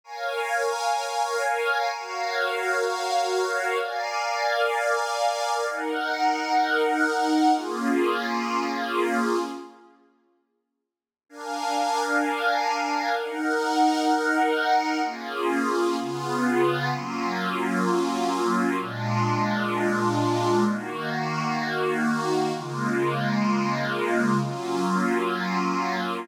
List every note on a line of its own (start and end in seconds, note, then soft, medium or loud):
0.04 1.90 A#4 medium
0.04 1.90 C#5 medium
0.04 1.90 F5 medium
0.04 1.90 G#5 medium
1.93 3.78 F#4 medium
1.93 3.78 A#4 medium
1.93 3.78 C#5 medium
1.93 3.78 F5 medium
3.79 5.65 A#4 medium
3.79 5.65 D5 medium
3.79 5.65 F5 medium
3.79 5.65 G#5 medium
5.66 7.52 D#4 medium
5.66 7.52 A#4 medium
5.66 7.52 F#5 medium
7.53 9.38 A#3 medium
7.53 9.38 C#4 medium
7.53 9.38 F4 medium
7.53 9.38 G#4 medium
11.29 13.15 D4 medium
11.29 13.15 A#4 medium
11.29 13.15 F5 medium
11.29 13.15 G#5 medium
13.16 15.02 D#4 medium
13.16 15.02 A#4 medium
13.16 15.02 F#5 medium
15.03 15.96 A#3 medium
15.03 15.96 C#4 medium
15.03 15.96 F4 medium
15.03 15.96 G#4 medium
15.98 16.91 C#3 medium
15.98 16.91 B3 medium
15.98 16.90 F4 medium
15.98 16.91 G#4 medium
16.91 18.76 F#3 medium
16.91 18.76 A#3 medium
16.91 18.76 C#4 medium
16.91 18.76 F4 medium
18.78 20.64 A#2 medium
18.78 20.64 G#3 medium
18.78 20.64 D4 medium
18.78 20.64 F4 medium
20.67 22.53 D#3 medium
20.67 22.53 A#3 medium
20.67 22.53 F#4 medium
22.53 24.39 C#3 medium
22.53 24.39 G#3 medium
22.53 24.39 A#3 medium
22.53 24.39 F4 medium
24.41 26.26 F#3 medium
24.41 26.26 A#3 medium
24.41 26.26 C#4 medium
24.41 26.26 F4 medium